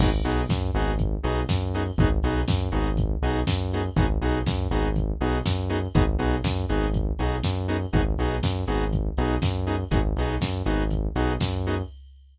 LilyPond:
<<
  \new Staff \with { instrumentName = "Lead 2 (sawtooth)" } { \time 4/4 \key gis \minor \tempo 4 = 121 <b dis' fis' gis'>8 <b dis' fis' gis'>4 <b dis' fis' gis'>4 <b dis' fis' gis'>4 <b dis' fis' gis'>8 | <b dis' fis' gis'>8 <b dis' fis' gis'>4 <b dis' fis' gis'>4 <b dis' fis' gis'>4 <b dis' fis' gis'>8 | <b dis' fis' gis'>8 <b dis' fis' gis'>4 <b dis' fis' gis'>4 <b dis' fis' gis'>4 <b dis' fis' gis'>8 | <b dis' fis' gis'>8 <b dis' fis' gis'>4 <b dis' fis' gis'>4 <b dis' fis' gis'>4 <b dis' fis' gis'>8 |
<b dis' fis' gis'>8 <b dis' fis' gis'>4 <b dis' fis' gis'>4 <b dis' fis' gis'>4 <b dis' fis' gis'>8 | <b dis' fis' gis'>8 <b dis' fis' gis'>4 <b dis' fis' gis'>4 <b dis' fis' gis'>4 <b dis' fis' gis'>8 | }
  \new Staff \with { instrumentName = "Synth Bass 1" } { \clef bass \time 4/4 \key gis \minor gis,,8 b,,8 fis,8 gis,,4 b,,8 fis,4 | gis,,8 b,,8 fis,8 gis,,4 b,,8 fis,4 | gis,,8 b,,8 fis,8 gis,,4 b,,8 fis,4 | gis,,8 b,,8 fis,8 gis,,4 b,,8 fis,4 |
gis,,8 b,,8 fis,8 gis,,4 b,,8 fis,4 | gis,,8 b,,8 fis,8 gis,,4 b,,8 fis,4 | }
  \new DrumStaff \with { instrumentName = "Drums" } \drummode { \time 4/4 <cymc bd>8 hho8 <bd sn>8 hho8 <hh bd>8 hho8 <bd sn>8 hho8 | <hh bd>8 hho8 <bd sn>8 hho8 <hh bd>8 hho8 <bd sn>8 hho8 | <hh bd>8 hho8 <bd sn>8 hho8 <hh bd>8 hho8 <bd sn>8 hho8 | <hh bd>8 hho8 <bd sn>8 hho8 <hh bd>8 hho8 <bd sn>8 hho8 |
<hh bd>8 hho8 <bd sn>8 hho8 <hh bd>8 hho8 <bd sn>8 hho8 | <hh bd>8 hho8 <bd sn>8 hho8 <hh bd>8 hho8 <bd sn>8 hho8 | }
>>